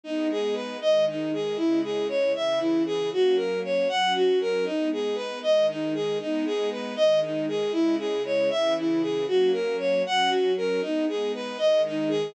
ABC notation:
X:1
M:6/8
L:1/8
Q:3/8=78
K:G#m
V:1 name="Violin"
D G B d D G | E G c e E G | F A c f F A | D G B d D G |
D G B d D G | E G c e E G | F A c f F A | D G B d D G |]
V:2 name="String Ensemble 1"
[G,B,D]3 [D,G,D]3 | [C,G,E]3 [C,E,E]3 | [F,A,C]3 [F,CF]3 | [G,B,D]3 [D,G,D]3 |
[G,B,D]3 [D,G,D]3 | [C,G,E]3 [C,E,E]3 | [F,A,C]3 [F,CF]3 | [G,B,D]3 [D,G,D]3 |]